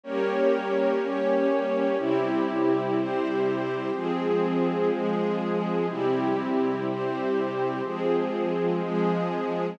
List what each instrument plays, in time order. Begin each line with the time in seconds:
0.03 string ensemble 1 G3 A#3 C#4, pad 5 (bowed) G4 A#4 C#5
1.01 pad 5 (bowed) C#4 G4 C#5
1.98 string ensemble 1 C3 G3 E4, pad 5 (bowed) C4 E4 G4
2.96 pad 5 (bowed) C4 G4 C5
3.93 string ensemble 1 F3 G#3 C4, pad 5 (bowed) F3 C4 G#4
4.91 pad 5 (bowed) F3 G#3 G#4
5.89 string ensemble 1 C3 G3 E4, pad 5 (bowed) C4 E4 G4
6.86 pad 5 (bowed) C4 G4 C5
7.84 pad 5 (bowed) F3 C4 G#4, string ensemble 1 F3 G#3 C4
8.82 pad 5 (bowed) F3 G#3 G#4